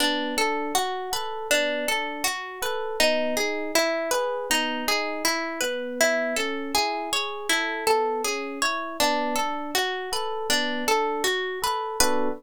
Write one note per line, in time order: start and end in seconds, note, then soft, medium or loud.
0.00 0.34 B3 medium
0.00 0.35 D4 medium
0.37 0.72 D4 medium
0.37 0.73 A4 medium
0.75 1.10 F#4 medium
1.12 1.47 A4 medium
1.12 1.48 B4 medium
1.50 1.85 B3 medium
1.50 1.86 D4 medium
1.87 2.22 D4 medium
1.87 2.23 A4 medium
2.24 2.59 F#4 medium
2.62 2.96 A4 medium
2.62 2.98 B4 medium
3.00 3.35 B3 loud
3.00 3.35 D#4 medium
3.37 3.71 D#4 medium
3.37 3.72 G#4 medium
3.75 4.10 E4 medium
4.11 4.47 G#4 medium
4.11 4.46 B4 medium
4.50 4.84 B3 medium
4.50 4.86 D#4 medium
4.88 5.22 D#4 medium
4.88 5.23 G#4 medium
5.25 5.59 E4 medium
5.25 5.60 E4 medium
5.61 6.34 B3 medium
5.61 5.96 B4 medium
6.01 6.36 E4 medium
6.36 6.72 C#4 medium
6.36 6.71 A4 medium
6.75 7.10 E4 medium
6.75 7.10 G#4 medium
7.12 7.47 G#4 medium
7.12 7.48 C#5 medium
7.49 7.85 E4 medium
7.49 7.84 A4 medium
7.87 8.22 B3 medium
7.87 8.22 A4 medium
8.24 8.59 C#4 medium
8.24 8.60 G#4 medium
8.62 8.97 E4 medium
8.62 8.97 C#5 medium
9.00 9.35 B3 loud
9.00 9.35 D4 medium
9.36 9.72 D4 medium
9.36 9.71 A4 medium
9.75 10.09 F#4 medium
9.75 10.10 F#4 medium
10.12 10.47 A4 medium
10.12 10.48 B4 medium
10.50 10.84 B3 medium
10.50 10.85 D4 medium
10.87 11.22 D4 medium
10.87 11.23 A4 medium
11.24 11.59 F#4 medium
11.62 11.97 A4 medium
11.62 11.99 B4 medium
12.00 12.29 B3 loud
12.00 12.29 D4 loud
12.00 12.29 F#4 loud
12.00 12.29 A4 loud
12.00 12.29 B4 loud